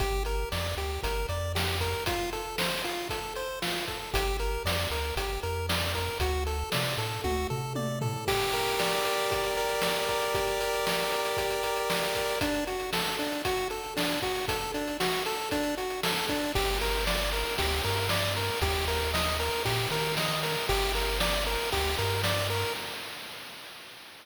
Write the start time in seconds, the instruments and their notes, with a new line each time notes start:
0.00 synth bass 1 G1, lead 1 (square) G4, kick, closed hi-hat
0.25 lead 1 (square) A#4, closed hi-hat
0.52 synth bass 1 F2, lead 1 (square) D5, snare
0.77 synth bass 1 D2, lead 1 (square) G4, closed hi-hat
1.03 synth bass 1 G1, lead 1 (square) A#4, kick, closed hi-hat
1.29 synth bass 1 F2, lead 1 (square) D5, closed hi-hat
1.55 lead 1 (square) G4, snare
1.80 lead 1 (square) A#4, kick, closed hi-hat
2.06 lead 1 (square) F4, kick, closed hi-hat
2.33 lead 1 (square) A4, closed hi-hat
2.58 lead 1 (square) C5, snare
2.84 lead 1 (square) F4, closed hi-hat
3.09 lead 1 (square) A4, kick, closed hi-hat
3.35 lead 1 (square) C5, closed hi-hat
3.62 lead 1 (square) F4, snare
3.87 lead 1 (square) A4, kick, closed hi-hat
4.14 synth bass 1 G1, lead 1 (square) G4, kick, closed hi-hat
4.39 lead 1 (square) A#4, closed hi-hat
4.65 synth bass 1 F2, lead 1 (square) D5, snare
4.91 synth bass 1 D2, lead 1 (square) A#4, closed hi-hat
5.16 synth bass 1 G1, lead 1 (square) G4, kick, closed hi-hat
5.43 synth bass 1 F2, lead 1 (square) A#4, closed hi-hat
5.69 lead 1 (square) D5, snare
5.94 lead 1 (square) A#4, kick, closed hi-hat
6.20 synth bass 1 D2, lead 1 (square) F#4, kick, closed hi-hat
6.47 lead 1 (square) A4, closed hi-hat
6.72 synth bass 1 C3, lead 1 (square) D5, snare
6.98 synth bass 1 A2, lead 1 (square) A4, closed hi-hat
7.24 synth bass 1 D2, lead 1 (square) F#4, kick, high tom
7.50 synth bass 1 C3, lead 1 (square) A4, floor tom
7.75 lead 1 (square) D5, high tom
8.01 lead 1 (square) A4, floor tom
8.27 lead 1 (square) G4, kick, crash
8.41 closed hi-hat
8.53 lead 1 (square) A#4, closed hi-hat
8.66 closed hi-hat
8.79 lead 1 (square) D5, snare
8.92 closed hi-hat
9.05 lead 1 (square) A#4, closed hi-hat
9.19 closed hi-hat
9.31 lead 1 (square) G4, kick, closed hi-hat
9.44 closed hi-hat
9.57 lead 1 (square) A#4, closed hi-hat
9.69 closed hi-hat
9.82 lead 1 (square) D5, snare
9.96 closed hi-hat
10.09 lead 1 (square) A#4, kick, closed hi-hat
10.22 closed hi-hat
10.34 lead 1 (square) G4, kick, closed hi-hat
10.47 closed hi-hat
10.60 lead 1 (square) A#4, closed hi-hat
10.73 closed hi-hat
10.86 lead 1 (square) D5, snare
11.00 closed hi-hat
11.12 lead 1 (square) A#4, closed hi-hat
11.25 closed hi-hat
11.37 lead 1 (square) G4, kick, closed hi-hat
11.50 closed hi-hat
11.63 lead 1 (square) A#4, closed hi-hat
11.76 closed hi-hat
11.90 lead 1 (square) D5, snare
12.02 closed hi-hat
12.15 lead 1 (square) A#4, kick, closed hi-hat
12.29 open hi-hat
12.41 lead 1 (square) D4, kick, closed hi-hat
12.55 closed hi-hat
12.67 lead 1 (square) F#4, closed hi-hat
12.80 closed hi-hat
12.93 lead 1 (square) A4, snare
13.06 closed hi-hat
13.19 lead 1 (square) D4, closed hi-hat
13.32 closed hi-hat
13.45 lead 1 (square) F#4, kick, closed hi-hat
13.57 closed hi-hat
13.70 lead 1 (square) A4, closed hi-hat
13.84 closed hi-hat
13.97 lead 1 (square) D4, snare
14.09 closed hi-hat
14.22 lead 1 (square) F#4, kick, closed hi-hat
14.35 open hi-hat
14.48 lead 1 (square) A4, kick, closed hi-hat
14.61 closed hi-hat
14.74 lead 1 (square) D4, closed hi-hat
14.87 closed hi-hat
15.00 lead 1 (square) F#4, snare
15.12 closed hi-hat
15.26 lead 1 (square) A4, closed hi-hat
15.39 closed hi-hat
15.51 lead 1 (square) D4, kick, closed hi-hat
15.63 closed hi-hat
15.77 lead 1 (square) F#4, closed hi-hat
15.90 closed hi-hat
16.03 lead 1 (square) A4, snare
16.17 closed hi-hat
16.28 lead 1 (square) D4, kick, closed hi-hat
16.43 closed hi-hat
16.55 synth bass 1 G1, lead 1 (square) G4, kick, crash
16.80 lead 1 (square) A#4, snare, ride
17.07 lead 1 (square) D5, snare
17.33 lead 1 (square) A#4, ride
17.58 synth bass 1 D2, lead 1 (square) G4, kick, ride
17.84 synth bass 1 G2, lead 1 (square) A#4, ride
18.09 lead 1 (square) D5, snare
18.36 lead 1 (square) A#4, ride
18.62 synth bass 1 D#2, lead 1 (square) G4, kick, ride
18.88 lead 1 (square) A#4, snare, ride
19.14 lead 1 (square) D#5, snare
19.39 lead 1 (square) A#4, ride
19.65 synth bass 1 A#2, lead 1 (square) G4, kick, ride
19.91 synth bass 1 D#3, lead 1 (square) A#4, ride
20.17 lead 1 (square) D#5, snare
20.43 lead 1 (square) A#4, ride
20.69 synth bass 1 G1, lead 1 (square) G4, kick, ride
20.94 lead 1 (square) A#4, snare, ride
21.20 lead 1 (square) D5, snare
21.47 lead 1 (square) A#4, ride
21.72 synth bass 1 D2, lead 1 (square) G4, kick, ride
21.98 synth bass 1 G2, lead 1 (square) A#4, ride
22.23 lead 1 (square) D5, snare
22.50 lead 1 (square) A#4, ride